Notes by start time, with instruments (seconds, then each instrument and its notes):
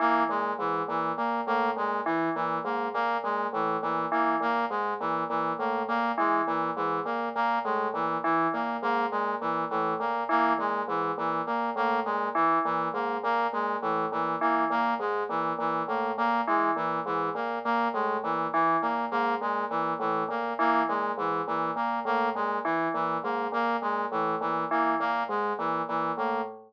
0.00 tubular bells E3, brass section A#3
0.29 tubular bells A#2, brass section G#3
0.59 tubular bells G#2, brass section E3
0.88 tubular bells A#2, brass section E3
1.17 tubular bells A#2, brass section A#3
1.47 tubular bells A2, brass section A#3
1.76 tubular bells A#2, brass section G#3
2.06 brass section E3, tubular bells E3
2.35 tubular bells A#2, brass section E3
2.64 tubular bells G#2, brass section A#3
2.94 tubular bells A#2, brass section A#3
3.24 tubular bells A#2, brass section G#3
3.53 tubular bells A2, brass section E3
3.82 tubular bells A#2, brass section E3
4.12 tubular bells E3, brass section A#3
4.40 tubular bells A#2, brass section A#3
4.70 tubular bells G#2, brass section G#3
5.00 tubular bells A#2, brass section E3
5.29 tubular bells A#2, brass section E3
5.59 tubular bells A2, brass section A#3
5.88 tubular bells A#2, brass section A#3
6.18 tubular bells E3, brass section G#3
6.47 tubular bells A#2, brass section E3
6.76 tubular bells G#2, brass section E3
7.05 tubular bells A#2, brass section A#3
7.35 tubular bells A#2, brass section A#3
7.64 tubular bells A2, brass section G#3
7.94 tubular bells A#2, brass section E3
8.24 brass section E3, tubular bells E3
8.53 tubular bells A#2, brass section A#3
8.82 tubular bells G#2, brass section A#3
9.11 tubular bells A#2, brass section G#3
9.41 tubular bells A#2, brass section E3
9.70 tubular bells A2, brass section E3
10.00 tubular bells A#2, brass section A#3
10.29 tubular bells E3, brass section A#3
10.59 tubular bells A#2, brass section G#3
10.88 tubular bells G#2, brass section E3
11.18 tubular bells A#2, brass section E3
11.47 tubular bells A#2, brass section A#3
11.76 tubular bells A2, brass section A#3
12.05 tubular bells A#2, brass section G#3
12.35 tubular bells E3, brass section E3
12.65 tubular bells A#2, brass section E3
12.94 tubular bells G#2, brass section A#3
13.23 tubular bells A#2, brass section A#3
13.53 tubular bells A#2, brass section G#3
13.82 tubular bells A2, brass section E3
14.12 tubular bells A#2, brass section E3
14.41 tubular bells E3, brass section A#3
14.70 tubular bells A#2, brass section A#3
15.00 tubular bells G#2, brass section G#3
15.29 tubular bells A#2, brass section E3
15.59 tubular bells A#2, brass section E3
15.88 tubular bells A2, brass section A#3
16.18 tubular bells A#2, brass section A#3
16.47 tubular bells E3, brass section G#3
16.76 tubular bells A#2, brass section E3
17.06 tubular bells G#2, brass section E3
17.35 tubular bells A#2, brass section A#3
17.65 tubular bells A#2, brass section A#3
17.94 tubular bells A2, brass section G#3
18.23 tubular bells A#2, brass section E3
18.53 brass section E3, tubular bells E3
18.82 tubular bells A#2, brass section A#3
19.11 tubular bells G#2, brass section A#3
19.41 tubular bells A#2, brass section G#3
19.70 tubular bells A#2, brass section E3
19.99 tubular bells A2, brass section E3
20.29 tubular bells A#2, brass section A#3
20.59 tubular bells E3, brass section A#3
20.88 tubular bells A#2, brass section G#3
21.18 tubular bells G#2, brass section E3
21.47 tubular bells A#2, brass section E3
21.76 tubular bells A#2, brass section A#3
22.05 tubular bells A2, brass section A#3
22.35 tubular bells A#2, brass section G#3
22.65 brass section E3, tubular bells E3
22.94 tubular bells A#2, brass section E3
23.24 tubular bells G#2, brass section A#3
23.52 tubular bells A#2, brass section A#3
23.82 tubular bells A#2, brass section G#3
24.12 tubular bells A2, brass section E3
24.41 tubular bells A#2, brass section E3
24.71 tubular bells E3, brass section A#3
25.00 tubular bells A#2, brass section A#3
25.29 tubular bells G#2, brass section G#3
25.59 tubular bells A#2, brass section E3
25.88 tubular bells A#2, brass section E3
26.18 tubular bells A2, brass section A#3